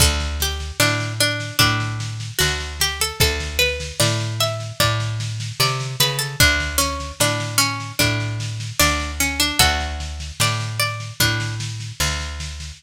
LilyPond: <<
  \new Staff \with { instrumentName = "Pizzicato Strings" } { \time 4/4 \key d \major \tempo 4 = 75 a'8 g'8 d'8 d'8 d'4 fis'8 g'16 a'16 | a'8 b'8 d''8 e''8 d''4 d''8 b'16 a'16 | d'8 cis'8 d'8 cis'8 d'4 d'8 cis'16 d'16 | <fis' a'>4 d''8 d''8 d'8 r4. | }
  \new Staff \with { instrumentName = "Electric Bass (finger)" } { \clef bass \time 4/4 \key d \major d,4 a,4 a,4 d,4 | d,4 a,4 a,4 c8 cis8 | d,4 a,4 a,4 d,4 | d,4 a,4 a,4 d,4 | }
  \new DrumStaff \with { instrumentName = "Drums" } \drummode { \time 4/4 <bd sn>16 sn16 sn16 sn16 sn16 sn16 sn16 sn16 <bd sn>16 sn16 sn16 sn16 sn16 sn16 sn16 sn16 | <bd sn>16 sn16 sn16 sn16 sn16 sn16 sn16 sn16 <bd sn>16 sn16 sn16 sn16 sn16 sn16 sn16 sn16 | <bd sn>16 sn16 sn16 sn16 sn16 sn16 sn16 sn16 <bd sn>16 sn16 sn16 sn16 sn16 sn16 sn16 sn16 | <bd sn>16 sn16 sn16 sn16 sn16 sn16 sn16 sn16 <bd sn>16 sn16 sn16 sn16 sn16 sn16 sn16 sn16 | }
>>